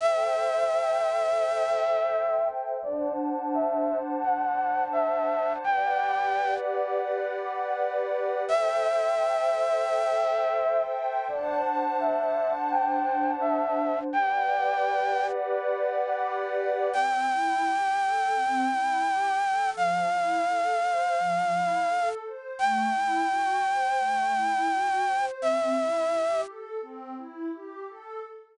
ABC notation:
X:1
M:4/4
L:1/16
Q:"Swing 16ths" 1/4=85
K:G
V:1 name="Flute"
e16 | d2 z2 e3 z f4 e4 | g6 z10 | e16 |
d2 z2 e3 z g4 e4 | g8 z8 | [K:C] g16 | f16 |
g16 | e6 z10 |]
V:2 name="Pad 2 (warm)"
[Aceg]16 | [Dcfa]16 | [GBdf]16 | [Aceg]16 |
[Dcfa]16 | [GBdf]16 | [K:C] C2 E2 G2 A2 C2 E2 G2 A2 | F,2 E2 A2 c2 F,2 E2 A2 c2 |
A,2 E2 ^F2 c2 A,2 E2 F2 c2 | C2 E2 G2 A2 C2 E2 G2 A2 |]